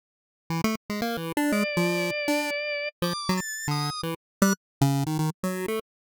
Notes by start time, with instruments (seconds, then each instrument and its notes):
0.50 lead 1 (square) E3
0.64 lead 1 (square) A3
0.90 lead 1 (square) G#3
1.02 lead 1 (square) A#3
1.17 lead 1 (square) E3
1.37 lead 1 (square) D4
1.52 lead 1 (square) G#3, drawbar organ D5
1.77 lead 1 (square) F3
2.28 lead 1 (square) D4
3.02 lead 1 (square) F3, drawbar organ D6
3.29 lead 1 (square) F#3
3.37 drawbar organ A6
3.68 lead 1 (square) D3, drawbar organ D#6
4.03 lead 1 (square) E3
4.42 lead 1 (square) G3, drawbar organ F#6
4.81 lead 1 (square) C#3
5.06 lead 1 (square) D#3
5.19 lead 1 (square) D#3
5.43 lead 1 (square) F#3
5.68 lead 1 (square) A3